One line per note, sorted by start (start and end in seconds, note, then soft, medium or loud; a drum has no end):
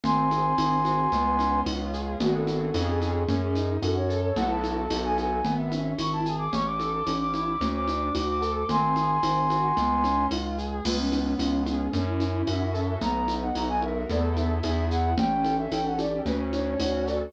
0.03 0.53 G#1 medium
0.03 0.58 C4 medium
0.03 1.61 G#5 medium
0.03 1.61 C6 medium
0.03 low conga loud
0.03 shaker medium
0.31 1.08 G#4 medium
0.31 high conga medium
0.31 shaker medium
0.58 1.07 G#1 medium
0.58 1.09 C4 medium
0.58 tambourine medium
0.58 high conga medium
0.58 shaker medium
0.84 1.10 F#4 medium
0.84 high conga medium
0.84 shaker medium
1.12 1.61 C#2 loud
1.12 2.15 B3 medium
1.12 low conga medium
1.12 shaker medium
1.39 2.16 C#4 medium
1.39 high conga medium
1.39 shaker medium
1.66 2.15 C#2 medium
1.66 2.18 F4 medium
1.66 tambourine medium
1.66 high conga medium
1.93 2.19 G#4 medium
1.93 shaker medium
2.20 2.70 G#1 loud
2.20 2.69 B3 medium
2.20 2.69 D4 medium
2.20 2.69 F#4 medium
2.20 2.34 F#4 medium
2.20 2.69 G#4 medium
2.20 low conga loud
2.20 shaker medium
2.34 2.78 A4 medium
2.47 high conga medium
2.47 shaker medium
2.74 3.24 F2 loud
2.74 3.23 B3 medium
2.74 3.23 C#4 loud
2.74 3.23 F4 medium
2.74 3.23 G#4 medium
2.74 tambourine medium
2.74 high conga medium
2.74 shaker medium
2.88 3.01 G#4 medium
3.01 3.34 G#4 medium
3.01 high conga medium
3.01 shaker medium
3.28 3.77 F#2 medium
3.28 3.56 C#4 medium
3.28 low conga medium
3.28 shaker medium
3.42 3.76 G#4 medium
3.55 3.82 D#4 medium
3.55 high conga medium
3.55 shaker medium
3.82 4.31 F#2 medium
3.82 4.09 F#4 medium
3.82 3.96 A4 medium
3.82 tambourine medium
3.82 high conga medium
3.82 shaker medium
3.96 4.22 C#5 medium
4.09 4.35 A4 medium
4.09 shaker medium
4.23 4.36 C#5 medium
4.36 4.86 B1 loud
4.36 4.85 B3 medium
4.36 4.85 E4 medium
4.36 4.85 F#4 medium
4.36 4.85 A4 medium
4.36 4.49 F#5 medium
4.36 low conga loud
4.36 shaker medium
4.50 4.98 A5 medium
4.64 high conga medium
4.64 shaker medium
4.90 5.40 B1 loud
4.90 5.39 B3 medium
4.90 5.39 D#4 medium
4.90 5.39 F#4 medium
4.90 5.39 A4 medium
4.90 tambourine medium
4.90 high conga medium
4.90 shaker medium
5.04 5.17 G#5 medium
5.18 5.54 G#5 medium
5.18 high conga medium
5.18 shaker medium
5.45 5.93 G#1 medium
5.45 5.72 B3 loud
5.45 low conga medium
5.45 shaker medium
5.58 5.95 E5 medium
5.71 5.98 C#4 medium
5.71 high conga medium
5.71 shaker medium
5.98 6.47 G#1 medium
5.98 6.26 E4 medium
5.98 6.12 C#6 medium
5.98 tambourine medium
5.98 high conga medium
5.98 shaker medium
6.12 6.36 A5 medium
6.25 6.51 G#4 medium
6.25 shaker medium
6.38 6.51 D6 medium
6.53 7.01 A1 medium
6.53 6.80 C#4 medium
6.53 6.66 C#6 medium
6.53 low conga medium
6.53 shaker medium
6.66 7.17 D6 medium
6.79 7.06 A4 medium
6.79 high conga medium
6.79 shaker medium
7.07 7.55 A1 medium
7.07 7.34 C#4 medium
7.07 tambourine medium
7.07 high conga medium
7.07 shaker medium
7.20 7.33 D6 medium
7.33 7.60 E4 medium
7.33 7.68 D6 medium
7.33 high conga medium
7.33 shaker medium
7.61 8.09 D2 loud
7.61 7.88 C#4 medium
7.61 low conga medium
7.61 shaker medium
7.74 8.13 D6 medium
7.88 8.15 D4 medium
7.88 high conga medium
7.88 shaker medium
8.15 8.64 D2 medium
8.15 8.42 F#4 medium
8.15 8.28 D6 medium
8.15 tambourine medium
8.15 high conga medium
8.15 shaker medium
8.28 8.54 D6 medium
8.41 8.67 A4 medium
8.41 shaker medium
8.56 8.68 D6 medium
8.69 9.18 G#1 medium
8.69 8.96 C4 medium
8.69 10.26 G#5 medium
8.69 10.26 C6 medium
8.69 low conga loud
8.69 shaker medium
8.96 9.23 G#4 medium
8.96 high conga medium
8.96 shaker medium
9.23 9.72 G#1 medium
9.23 9.50 C4 medium
9.23 tambourine medium
9.23 high conga medium
9.23 shaker medium
9.50 9.76 F#4 medium
9.50 high conga medium
9.50 shaker medium
9.77 10.26 C#2 loud
9.77 10.04 B3 medium
9.77 low conga medium
9.77 shaker medium
10.04 10.31 C#4 medium
10.04 high conga medium
10.04 shaker medium
10.31 10.80 C#2 medium
10.31 10.58 F4 medium
10.31 tambourine medium
10.31 high conga medium
10.58 10.84 G#4 medium
10.58 shaker medium
10.85 11.34 C#2 loud
10.85 11.88 B3 loud
10.85 10.97 F4 medium
10.85 crash loud
10.85 low conga loud
10.85 shaker medium
10.99 11.33 C#4 medium
11.12 11.90 C#4 medium
11.12 high conga medium
11.12 shaker medium
11.39 11.88 C#2 medium
11.39 11.61 C#4 medium
11.39 11.90 F4 medium
11.39 tambourine medium
11.39 high conga medium
11.39 shaker medium
11.66 11.92 C#4 medium
11.66 11.91 G#4 medium
11.66 high conga medium
11.66 shaker medium
11.92 12.42 F#2 loud
11.92 12.96 C#4 medium
11.92 12.05 D4 medium
11.92 low conga medium
11.92 shaker medium
12.07 12.45 E4 medium
12.20 12.97 E4 medium
12.20 high conga medium
12.20 shaker medium
12.47 12.96 F#2 medium
12.47 12.99 F#4 medium
12.47 12.72 E5 medium
12.47 tambourine medium
12.47 high conga medium
12.47 shaker medium
12.73 12.99 A4 medium
12.73 12.86 E5 medium
12.73 shaker medium
12.87 13.00 E5 medium
13.01 13.50 B1 medium
13.01 14.04 B3 medium
13.01 13.34 A#5 medium
13.01 low conga medium
13.01 shaker medium
13.28 14.05 D#4 medium
13.28 high conga medium
13.28 shaker medium
13.42 13.55 F#5 medium
13.55 14.04 B1 medium
13.55 14.07 F#4 medium
13.55 13.68 A#5 medium
13.55 tambourine medium
13.55 high conga medium
13.55 shaker medium
13.68 13.81 G#5 medium
13.82 14.07 A#4 medium
13.82 14.06 E5 medium
13.82 high conga medium
14.09 14.59 E2 medium
14.09 14.59 B3 medium
14.09 14.59 E4 medium
14.09 14.59 A4 medium
14.09 14.23 D5 medium
14.09 low conga medium
14.09 shaker medium
14.37 14.62 E5 medium
14.37 high conga medium
14.37 shaker medium
14.63 15.13 E2 medium
14.63 15.12 B3 medium
14.63 15.12 E4 medium
14.63 15.12 G#4 medium
14.63 14.85 E5 medium
14.63 tambourine medium
14.63 high conga medium
14.63 shaker medium
14.90 15.14 F#5 medium
14.90 shaker medium
15.18 15.66 A1 medium
15.18 15.72 C#4 medium
15.18 15.56 G5 medium
15.18 low conga loud
15.18 shaker medium
15.44 16.21 A4 medium
15.44 high conga medium
15.44 shaker medium
15.59 15.71 E5 medium
15.71 16.20 A1 medium
15.71 16.24 C#4 medium
15.71 15.85 G5 medium
15.71 tambourine medium
15.71 high conga medium
15.71 shaker medium
15.85 15.98 F#5 medium
15.99 16.25 G4 medium
15.99 16.21 D5 medium
15.99 high conga medium
15.99 shaker medium
16.26 16.74 D2 loud
16.26 17.28 C#4 medium
16.26 16.39 B4 medium
16.26 low conga medium
16.26 shaker medium
16.52 17.30 D4 medium
16.52 16.79 C#5 medium
16.52 high conga medium
16.52 shaker medium
16.80 17.28 D2 medium
16.80 17.31 F#4 medium
16.80 17.06 C#5 medium
16.80 tambourine medium
16.80 high conga medium
16.80 shaker medium
17.06 17.33 A4 medium
17.06 17.30 D5 medium
17.06 shaker medium